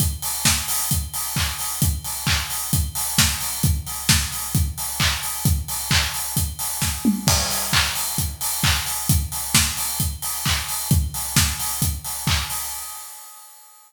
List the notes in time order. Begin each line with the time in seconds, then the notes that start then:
0.00 kick, closed hi-hat
0.22 open hi-hat
0.45 kick, snare
0.68 open hi-hat
0.91 kick, closed hi-hat
1.14 open hi-hat
1.36 kick, clap
1.59 open hi-hat
1.82 kick, closed hi-hat
2.04 open hi-hat
2.27 kick, clap
2.50 open hi-hat
2.73 kick, closed hi-hat
2.95 open hi-hat
3.18 kick, snare
3.41 open hi-hat
3.63 kick, closed hi-hat
3.87 open hi-hat
4.09 kick, snare
4.32 open hi-hat
4.55 kick, closed hi-hat
4.78 open hi-hat
5.00 kick, clap
5.23 open hi-hat
5.45 kick, closed hi-hat
5.68 open hi-hat
5.91 kick, clap
6.14 open hi-hat
6.37 kick, closed hi-hat
6.59 open hi-hat
6.82 kick, snare
7.05 mid tom
7.27 kick, crash
7.50 open hi-hat
7.73 kick, clap
7.95 open hi-hat
8.18 kick, closed hi-hat
8.41 open hi-hat
8.63 kick, clap
8.86 open hi-hat
9.09 kick, closed hi-hat
9.32 open hi-hat
9.55 kick, snare
9.77 open hi-hat
10.00 kick, closed hi-hat
10.22 open hi-hat
10.45 kick, clap
10.68 open hi-hat
10.91 kick, closed hi-hat
11.14 open hi-hat
11.36 kick, snare
11.59 open hi-hat
11.82 kick, closed hi-hat
12.04 open hi-hat
12.27 kick, clap
12.50 open hi-hat